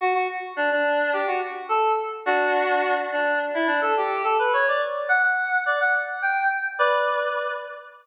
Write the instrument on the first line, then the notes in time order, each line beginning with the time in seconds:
lead 1 (square)
0.01 F#4
0.14 F#4
0.56 D4
0.71 D4
1.13 G4
1.27 F#4
1.69 A4
2.26 D4 F#4
3.12 D4
3.54 E4
3.67 D4
3.81 A4
3.97 G4
4.24 A4
4.39 B4
4.53 C#5
4.68 D5
5.09 F#5
5.23 F#5
5.66 D5
5.80 F#5
6.22 G5
6.79 B4 D5